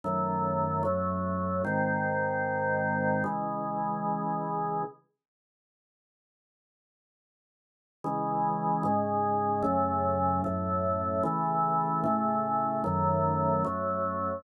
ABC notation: X:1
M:4/4
L:1/8
Q:1/4=75
K:C#m
V:1 name="Drawbar Organ"
[F,,D,A,]2 [F,,F,A,]2 | [G,,D,^B,]4 [C,E,G,]4 | z8 | [C,E,G,]2 [G,,C,G,]2 [F,,C,A,]2 [F,,A,,A,]2 |
[C,E,A,]2 [A,,C,A,]2 [F,,D,A,]2 [F,,F,A,]2 |]